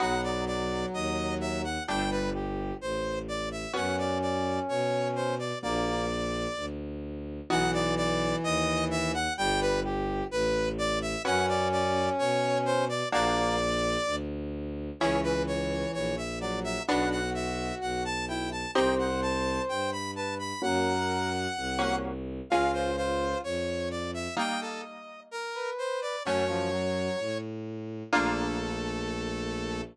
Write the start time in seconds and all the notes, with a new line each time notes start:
0.00 B1 F#3 B3 D#4 F#4 F#5
0.23 D5
0.47 D5
0.94 D#2 D#5
1.41 E5
1.64 F#5
1.88 G1 G3 A3 D4 G4 G5
2.11 B4
2.34 G4
2.81 A1 C5
3.28 D5
3.52 E5
3.73 F#2 B3 C#4 F#4 F#5
3.98 D5
4.22 D5
4.69 B2 C#5
5.16 C5
5.39 D5
5.62 A#1 A#3 D4 F#4 D5
6.56 D2
7.50 B1 E3 B3 D#4 F#4 F#5
7.73 D5
7.97 D5
8.44 D#2 D#5
8.91 E5
9.14 F#5
9.38 G1 G3 G5
9.61 B4
9.84 G4
10.31 A1 B4
10.78 D5
11.02 E5
11.25 F#2 B3 C#4 F#4 F#5
11.48 D5
11.72 D5
12.19 B2 C#5
12.66 C5
12.89 D5
13.12 A#1 A#3 D4 F#4 D5
14.06 D2
15.00 C#2 E3 C#4 E4 G#4 C#5
15.23 B4
15.47 C#5
15.94 A#1 C#5
16.17 E5
16.41 F#3 D5
16.64 E5
16.88 B1 B3 D4 F#4 F#5
17.11 F#5
17.34 E5
17.81 B1 F#5
18.05 A5
18.28 E4 G5
18.52 A5
18.75 C2 C4 D#4 G4 C5 G5
18.98 F#5
19.22 A5
19.69 G2 G5
19.92 B5
20.16 B4 A5
20.39 B5
20.62 F#2 A#3 C#4 F#4 A#4 F#5
21.56 C2
21.79 A#3 C#4 F#4
22.50 C#2 G#3 C#4 F4 F5
22.73 C5
22.97 F4 C5
23.44 F2 C#5
23.91 D5
24.14 E5
24.37 G3 A#3 D#4 D#5 G5
24.61 A4
25.31 A#4
25.55 B4
25.78 C5
26.02 D5
26.25 F#2 F#3 A3 C#4 C#5
26.48 F3
26.72 F#3
27.19 A2
28.12 A#1 A3 A#3 D4 F4 A4